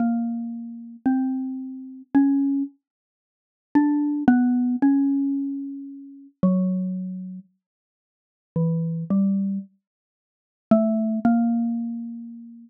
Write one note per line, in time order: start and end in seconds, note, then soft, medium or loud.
0.00 0.96 A#3 medium
1.06 2.02 C4 medium
2.15 2.63 C#4 medium
3.75 4.23 D4 medium
4.28 4.76 B3 loud
4.82 6.27 C#4 medium
6.43 7.40 F#3 medium
8.56 9.04 E3 medium
9.10 9.59 G3 medium
10.71 11.19 A3 loud
11.25 12.70 A#3 medium